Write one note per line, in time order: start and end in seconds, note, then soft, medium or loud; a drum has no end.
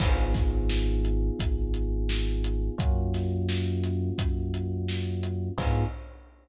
0.00 1.30 G#1 loud
0.00 2.75 B3 medium
0.00 2.75 D#4 medium
0.00 2.75 F4 medium
0.00 2.75 G#4 medium
0.00 kick loud
0.00 crash loud
0.34 kick loud
0.34 snare medium
0.34 closed hi-hat medium
0.69 snare loud
1.05 closed hi-hat medium
1.39 2.70 G#1 medium
1.39 kick loud
1.39 closed hi-hat loud
1.74 closed hi-hat medium
2.09 snare loud
2.44 closed hi-hat medium
2.78 4.10 F#2 loud
2.78 5.53 A#3 medium
2.78 5.53 C#4 medium
2.78 5.53 F4 medium
2.78 5.53 F#4 medium
2.78 kick loud
2.78 closed hi-hat loud
3.14 snare medium
3.14 closed hi-hat medium
3.49 snare loud
3.83 snare soft
3.83 closed hi-hat medium
4.18 5.49 F#2 medium
4.18 kick loud
4.18 closed hi-hat loud
4.54 closed hi-hat medium
4.88 snare loud
5.23 closed hi-hat medium
5.58 5.84 G#2 loud
5.58 5.84 B3 loud
5.58 5.84 D#4 loud
5.58 5.84 F4 loud
5.58 5.84 G#4 loud
5.58 kick loud
5.58 crash loud